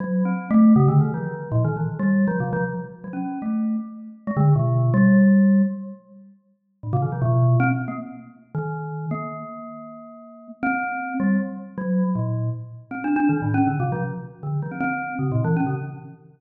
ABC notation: X:1
M:6/4
L:1/16
Q:1/4=158
K:none
V:1 name="Glockenspiel"
(3^F,4 C4 A,4 (3^C,2 D,2 ^D,2 =F,4 (3^A,,2 D,2 E,2 z G,3 | (3F,2 C,2 F,2 z4 ^F, ^C3 A,4 z5 ^G, D,2 | B,,4 G,8 z12 | A,, C, ^D, F, B,,4 C z2 ^A, z6 D,6 |
^A,16 C6 G,2 | z4 ^F,3 z ^A,,4 z4 (3C2 D2 D2 (3^D,2 =A,,2 ^C2 | (3D,2 C,2 F,2 z4 D,2 F, C C4 (3^C,2 ^A,,2 E,2 ^C C, z2 |]